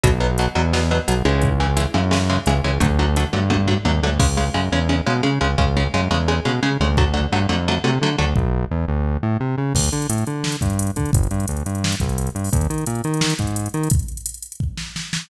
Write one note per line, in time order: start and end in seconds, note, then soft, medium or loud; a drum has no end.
0.03 0.48 B1 medium
0.03 0.10 B2 medium
0.03 0.10 F#3 medium
0.03 kick loud
0.03 closed hi-hat loud
0.20 0.27 B2 medium
0.20 0.27 F#3 medium
0.38 0.46 B2 medium
0.38 0.46 F#3 medium
0.38 closed hi-hat loud
0.55 1.00 E2 medium
0.55 0.62 B2 medium
0.55 0.62 F#3 medium
0.73 0.80 B2 medium
0.73 0.80 F#3 medium
0.73 snare loud
0.91 0.98 B2 medium
0.91 0.98 F#3 medium
1.08 1.23 B1 medium
1.08 1.15 B2 medium
1.08 1.15 F#3 medium
1.08 closed hi-hat loud
1.25 1.87 C#2 medium
1.25 1.49 C#3 medium
1.25 1.49 E3 medium
1.25 1.49 G#3 medium
1.42 kick loud
1.42 closed hi-hat medium
1.60 1.67 C#3 medium
1.60 1.67 E3 medium
1.60 1.67 G#3 medium
1.77 1.84 C#3 medium
1.77 1.84 E3 medium
1.77 1.84 G#3 medium
1.77 closed hi-hat loud
1.94 2.39 F#2 medium
1.94 2.01 C#3 medium
1.94 2.01 E3 medium
1.94 2.01 G#3 medium
2.11 2.18 C#3 medium
2.11 2.18 E3 medium
2.11 2.18 G#3 medium
2.11 snare loud
2.30 2.36 C#3 medium
2.30 2.36 E3 medium
2.30 2.36 G#3 medium
2.46 2.61 C#2 medium
2.46 2.54 C#3 medium
2.46 2.54 E3 medium
2.46 2.54 G#3 medium
2.46 closed hi-hat medium
2.64 2.79 C#2 medium
2.64 2.71 C#3 medium
2.64 2.71 E3 medium
2.64 2.71 G#3 medium
2.80 3.25 D2 loud
2.80 2.87 D3 medium
2.80 2.87 F#3 medium
2.80 2.87 A3 medium
2.80 kick loud
2.80 closed hi-hat loud
2.99 3.06 D3 medium
2.99 3.06 F#3 medium
2.99 3.06 A3 medium
3.16 3.24 D3 medium
3.16 3.24 F#3 medium
3.16 3.24 A3 medium
3.16 closed hi-hat loud
3.33 3.78 G2 medium
3.33 3.40 D3 medium
3.33 3.40 F#3 medium
3.33 3.40 A3 medium
3.50 3.57 D3 medium
3.50 3.57 F#3 medium
3.50 3.57 A3 medium
3.50 kick medium
3.50 high tom medium
3.67 3.74 D3 medium
3.67 3.74 F#3 medium
3.67 3.74 A3 medium
3.67 floor tom medium
3.85 4.01 D#2 medium
3.85 3.92 D3 medium
3.85 3.92 F#3 medium
3.85 3.92 A3 soft
3.85 high tom medium
4.03 4.18 D2 medium
4.03 4.10 D3 medium
4.03 4.10 F#3 medium
4.03 4.10 A3 medium
4.19 4.50 C#2 medium
4.19 4.26 C#3 medium
4.19 4.26 G#3 medium
4.19 kick loud
4.19 crash loud
4.37 4.44 C#3 medium
4.37 4.44 G#3 medium
4.54 4.69 F#2 medium
4.54 4.61 C#3 medium
4.54 4.61 G#3 medium
4.72 5.01 E2 medium
4.72 4.79 C#3 medium
4.72 4.79 G#3 medium
4.89 4.96 C#3 medium
4.89 4.96 G#3 medium
5.06 5.22 B2 medium
5.06 5.13 C#3 medium
5.06 5.13 G#3 medium
5.23 5.30 C#3 medium
5.23 5.39 C#3 medium
5.23 5.30 G#3 medium
5.41 5.56 C#2 medium
5.41 5.48 C#3 medium
5.41 5.48 G#3 medium
5.58 5.88 C#2 medium
5.58 5.65 C#3 medium
5.58 5.65 G#3 medium
5.58 kick loud
5.77 5.83 C#3 medium
5.77 5.83 G#3 medium
5.94 6.08 F#2 medium
5.94 6.01 C#3 medium
5.94 6.01 G#3 medium
6.11 6.40 E2 medium
6.11 6.18 C#3 medium
6.11 6.18 G#3 medium
6.28 6.35 C#3 medium
6.28 6.35 G#3 medium
6.45 6.60 B2 medium
6.45 6.52 C#3 medium
6.45 6.52 G#3 medium
6.63 6.70 C#3 medium
6.63 6.77 C#3 medium
6.63 6.70 G#3 medium
6.80 7.27 D2 medium
6.80 6.88 C#3 medium
6.80 6.88 G#3 medium
6.97 7.05 D3 medium
6.97 7.05 F#3 medium
6.97 7.05 A3 medium
6.97 kick loud
7.14 7.21 D3 medium
7.14 7.21 F#3 medium
7.14 7.21 A3 medium
7.32 7.47 G2 medium
7.32 7.39 D3 medium
7.32 7.39 F#3 medium
7.32 7.39 A3 medium
7.49 7.79 F2 medium
7.49 7.56 D3 medium
7.49 7.56 F#3 medium
7.49 7.56 A3 medium
7.68 7.75 D3 medium
7.68 7.75 F#3 medium
7.68 7.75 A3 medium
7.84 7.99 C3 medium
7.84 7.91 D3 medium
7.84 7.91 F#3 medium
7.84 7.91 A3 medium
8.01 8.16 D3 medium
8.01 8.10 D3 medium
8.01 8.10 F#3 medium
8.01 8.10 A3 medium
8.18 8.34 D2 medium
8.18 8.25 D3 medium
8.18 8.25 F#3 medium
8.18 8.25 A3 medium
8.36 8.65 B1 medium
8.36 kick loud
8.71 8.86 E2 medium
8.88 9.18 D2 medium
9.23 9.38 A2 medium
9.40 9.56 C3 medium
9.58 9.73 C#3 medium
9.75 9.90 D2 medium
9.75 kick loud
9.75 crash loud
9.84 closed hi-hat medium
9.92 10.07 D3 medium
9.92 closed hi-hat medium
10.02 closed hi-hat medium
10.10 10.24 A2 medium
10.10 closed hi-hat loud
10.18 closed hi-hat medium
10.27 10.57 D3 medium
10.27 closed hi-hat medium
10.44 snare loud
10.52 closed hi-hat medium
10.61 10.91 G2 medium
10.61 kick medium
10.61 closed hi-hat medium
10.70 closed hi-hat medium
10.79 closed hi-hat loud
10.87 closed hi-hat medium
10.96 11.11 D3 medium
10.96 kick medium
10.96 closed hi-hat medium
11.05 closed hi-hat medium
11.13 11.28 G1 medium
11.13 kick loud
11.13 closed hi-hat loud
11.23 closed hi-hat medium
11.31 11.46 G2 medium
11.31 closed hi-hat medium
11.40 closed hi-hat medium
11.48 11.63 D2 medium
11.48 closed hi-hat loud
11.57 closed hi-hat medium
11.66 11.95 G2 medium
11.66 closed hi-hat medium
11.75 closed hi-hat medium
11.84 snare loud
11.92 closed hi-hat medium
12.00 12.30 C2 medium
12.00 kick medium
12.00 closed hi-hat medium
12.09 closed hi-hat medium
12.18 closed hi-hat loud
12.27 closed hi-hat medium
12.35 12.50 G2 medium
12.35 closed hi-hat medium
12.44 open hi-hat medium
12.53 12.67 D#2 medium
12.53 kick loud
12.53 closed hi-hat loud
12.61 closed hi-hat medium
12.70 12.85 D#3 medium
12.70 closed hi-hat medium
12.78 closed hi-hat medium
12.86 13.02 A#2 medium
12.86 closed hi-hat loud
12.95 closed hi-hat medium
13.04 13.34 D#3 medium
13.04 closed hi-hat medium
13.14 closed hi-hat medium
13.21 snare loud
13.30 closed hi-hat medium
13.39 13.68 G#2 medium
13.39 kick medium
13.39 closed hi-hat medium
13.47 closed hi-hat medium
13.56 closed hi-hat loud
13.66 closed hi-hat medium
13.74 13.89 D#3 medium
13.74 closed hi-hat medium
13.83 closed hi-hat medium
13.90 kick loud
13.90 closed hi-hat loud
13.99 closed hi-hat medium
14.08 closed hi-hat medium
14.17 closed hi-hat medium
14.26 closed hi-hat loud
14.34 closed hi-hat medium
14.42 closed hi-hat loud
14.52 closed hi-hat medium
14.60 kick medium
14.77 snare medium
14.96 snare medium
15.13 snare loud